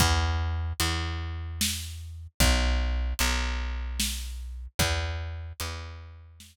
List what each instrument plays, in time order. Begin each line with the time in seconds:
0.00 electric bass (finger) E2, kick, closed hi-hat
0.80 electric bass (finger) E2, closed hi-hat
1.61 snare
2.40 electric bass (finger) B1, kick, closed hi-hat
3.19 electric bass (finger) B1, closed hi-hat
4.00 snare
4.79 electric bass (finger) E2, kick, closed hi-hat
5.60 electric bass (finger) E2, closed hi-hat
6.40 snare